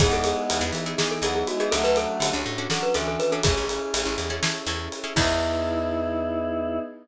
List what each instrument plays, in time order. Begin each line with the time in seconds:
0.00 electric bass (finger) E2, choir aahs G#3 B3, pad 5 (bowed) B3 D#4 E4 G#4, pizzicato strings B3 D#4 E4 G#4, glockenspiel G#4, kick, ride
0.11 electric bass (finger) E2, glockenspiel A4
0.24 glockenspiel G#4, ride
0.50 electric bass (finger) E2, ride
0.61 electric bass (finger) E2, pizzicato strings B3 D#4 E4 G#4
0.72 electric bass (finger) E3, ride
0.86 pizzicato strings B3 D#4 E4 G#4
0.98 choir aahs E3, pizzicato strings B3 D#4 E4 G#4, glockenspiel G#4, snare
1.11 glockenspiel A4
1.22 electric bass (finger) E2, choir aahs F#3, pizzicato strings B3 D#4 E4 G#4, glockenspiel G#4, ride
1.35 glockenspiel G#4
1.47 choir aahs G#3, glockenspiel F#4, ride
1.60 pizzicato strings B3 D#4 E4 G#4, glockenspiel G#4
1.71 electric bass (finger) D2, choir aahs F#3 A3, pizzicato strings C#4 D4 F#4 A4, pad 5 (bowed) C#4 D4 F#4 A4, glockenspiel A4, ride
1.84 electric bass (finger) D2, glockenspiel B4
1.96 glockenspiel A4, ride
2.20 electric bass (finger) D3, ride
2.33 electric bass (finger) D2, pizzicato strings C#4 D4 F#4 A4
2.46 electric bass (finger) A2
2.58 pizzicato strings C#4 D4 F#4 A4
2.70 choir aahs F#3, pizzicato strings C#4 D4 F#4 A4, glockenspiel A4, snare
2.83 glockenspiel B4
2.94 electric bass (finger) D2, choir aahs E3, pizzicato strings C#4 D4 F#4 A4, glockenspiel A4, ride
3.08 glockenspiel A4
3.19 choir aahs E3, glockenspiel B4, ride
3.32 pizzicato strings C#4 D4 F#4 A4, glockenspiel A4
3.43 electric bass (finger) A1, choir aahs C#4, pad 5 (bowed) C#4 E4 G#4 A4, pizzicato strings C#4 E4 G#4 A4, glockenspiel G#4, kick, ride
3.57 electric bass (finger) A1
3.69 choir aahs C#4, ride
3.94 electric bass (finger) A1, ride
4.05 electric bass (finger) A1, pizzicato strings C#4 E4 G#4 A4
4.18 electric bass (finger) E2, ride
4.30 pizzicato strings C#4 E4 G#4 A4
4.43 pizzicato strings C#4 E4 G#4 A4, snare
4.66 electric bass (finger) E2, pizzicato strings C#4 E4 G#4 A4, ride
4.92 ride
5.04 pizzicato strings C#4 E4 G#4 A4
5.16 electric bass (finger) E2, pad 5 (bowed) B3 D#4 E4 G#4, pizzicato strings B3 D#4 E4 G#4, glockenspiel E4, choir aahs E4, kick, crash